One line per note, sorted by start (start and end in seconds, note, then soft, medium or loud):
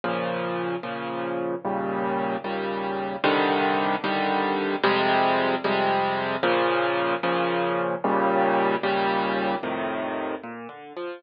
0.04 0.76 A#2 medium
0.04 0.76 C#3 medium
0.04 0.76 F3 medium
0.83 1.55 A#2 medium
0.83 1.55 C#3 medium
0.83 1.55 F3 medium
1.65 2.37 D#2 medium
1.65 2.37 A#2 medium
1.65 2.37 C#3 medium
1.65 2.37 G3 medium
2.44 3.16 D#2 medium
2.44 3.16 A#2 medium
2.44 3.16 C#3 medium
2.44 3.16 G3 medium
3.24 3.96 C2 loud
3.24 3.96 D3 loud
3.24 3.96 D#3 loud
3.24 3.96 G3 loud
4.04 4.76 C2 loud
4.04 4.76 D3 loud
4.04 4.76 D#3 medium
4.04 4.76 G3 loud
4.84 5.56 F2 loud
4.84 5.56 C3 loud
4.84 5.56 G3 loud
4.84 5.56 G#3 loud
5.64 6.36 F2 loud
5.64 6.36 C3 loud
5.64 6.36 G3 loud
5.64 6.36 G#3 loud
6.43 7.15 A#2 loud
6.43 7.15 C#3 loud
6.43 7.15 F3 loud
7.23 7.95 A#2 loud
7.23 7.95 C#3 loud
7.23 7.95 F3 loud
8.04 8.76 D#2 loud
8.04 8.76 A#2 loud
8.04 8.76 C#3 loud
8.04 8.76 G3 loud
8.83 9.55 D#2 loud
8.83 9.55 A#2 loud
8.83 9.55 C#3 loud
8.83 9.55 G3 loud
9.63 10.35 F2 medium
9.63 10.35 A2 medium
9.63 10.35 C3 medium
9.63 10.35 D#3 medium
10.44 10.68 A#2 medium
10.69 10.93 D3 medium
10.97 11.21 F3 medium